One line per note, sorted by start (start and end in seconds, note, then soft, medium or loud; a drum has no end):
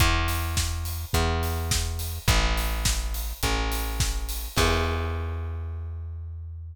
0.00 1.05 E2 loud
0.00 kick loud
0.00 closed hi-hat loud
0.28 open hi-hat medium
0.57 kick medium
0.57 snare loud
0.85 open hi-hat medium
1.13 2.19 E2 medium
1.13 kick medium
1.13 closed hi-hat loud
1.43 open hi-hat medium
1.71 kick loud
1.71 snare loud
1.99 open hi-hat medium
2.28 3.33 A1 loud
2.28 kick loud
2.28 closed hi-hat loud
2.58 open hi-hat medium
2.85 kick loud
2.85 snare loud
3.14 open hi-hat medium
3.43 4.48 A1 medium
3.43 kick medium
3.43 closed hi-hat loud
3.72 open hi-hat medium
4.00 kick loud
4.00 snare loud
4.29 open hi-hat medium
4.57 6.74 E2 loud
4.57 kick loud
4.57 crash loud